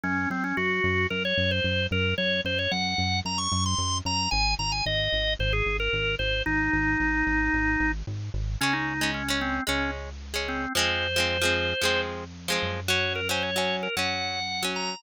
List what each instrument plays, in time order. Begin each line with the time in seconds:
0.03 synth bass 1 F#2, drawbar organ C#4
0.30 synth bass 1 F#2, drawbar organ C4
0.44 drawbar organ C#4
0.57 synth bass 1 F#2, drawbar organ F#4
0.84 synth bass 1 F#2
1.10 synth bass 1 F#2, drawbar organ A#4
1.25 drawbar organ C#5
1.37 synth bass 1 F#2
1.51 drawbar organ C5
1.64 synth bass 1 F#2
1.91 synth bass 1 F#2, drawbar organ A#4
2.18 synth bass 1 F#2, drawbar organ C#5
2.45 synth bass 1 F#2, drawbar organ C5
2.59 drawbar organ C#5
2.71 synth bass 1 F#2, drawbar organ F#5
2.98 synth bass 1 F#2
3.25 synth bass 1 F#2, drawbar organ A#5
3.38 drawbar organ C#6
3.52 synth bass 1 F#2
3.66 drawbar organ C6
3.78 synth bass 1 F#2
4.05 synth bass 1 F#2, drawbar organ A#5
4.31 synth bass 1 G#1, drawbar organ G#5
4.59 synth bass 1 G#1, drawbar organ A#5
4.72 drawbar organ G#5
4.86 synth bass 1 G#1, drawbar organ D#5
5.12 synth bass 1 G#1
5.39 synth bass 1 G#1, drawbar organ C5
5.53 drawbar organ G#4
5.66 synth bass 1 G#1
5.80 drawbar organ A#4
5.93 synth bass 1 G#1
6.19 synth bass 1 G#1, drawbar organ C5
6.46 synth bass 1 G#1, drawbar organ D#4
6.73 synth bass 1 G#1
7.00 synth bass 1 G#1
7.27 synth bass 1 G#1
7.53 synth bass 1 G#1
7.80 synth bass 1 G#1
8.07 synth bass 1 G#1
8.34 synth bass 1 G#1
8.61 synth bass 1 C#2, acoustic guitar (steel) G#3 C#4, drawbar organ C#4
8.73 drawbar organ D#4
9.01 acoustic guitar (steel) G#3 C#4
9.14 drawbar organ C#4
9.28 acoustic guitar (steel) G#3 C#4
9.41 drawbar organ C4
9.67 synth bass 1 C#2, acoustic guitar (steel) G#3 C#4, drawbar organ C#4
10.34 acoustic guitar (steel) G#3 C#4
10.48 drawbar organ C4
10.75 synth bass 1 F2, acoustic guitar (steel) F3 G#3 C4, drawbar organ C5
11.16 acoustic guitar (steel) F3 G#3 C4
11.42 acoustic guitar (steel) F3 G#3 C4
11.81 synth bass 1 F2, acoustic guitar (steel) F3 G#3 C4
12.48 acoustic guitar (steel) F3 G#3 C4
12.62 synth bass 1 F#2
12.88 acoustic guitar (steel) F#3 C#4, drawbar organ C#5
13.15 drawbar organ A#4
13.29 acoustic guitar (steel) F#3 C#4, drawbar organ C5
13.43 drawbar organ C#5
13.56 acoustic guitar (steel) F#3 C#4
13.83 drawbar organ A#4
13.96 synth bass 1 F#2, acoustic guitar (steel) F#3 C#4, drawbar organ F#5
14.63 acoustic guitar (steel) F#3 C#4
14.76 drawbar organ A#5